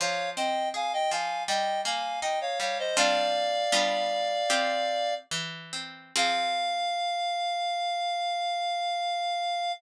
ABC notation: X:1
M:4/4
L:1/16
Q:1/4=81
K:Fm
V:1 name="Clarinet"
[df]2 [eg]2 [fa] [eg] [fa]2 [eg]2 [fa]2 [eg] [df] [df] [ce] | "^rit." [=df]12 z4 | f16 |]
V:2 name="Harpsichord"
F,2 C2 A2 F,2 G,2 B,2 E2 G,2 | "^rit." [G,C=DF]4 [G,=B,DF]4 [CFG]4 =E,2 C2 | [F,CA]16 |]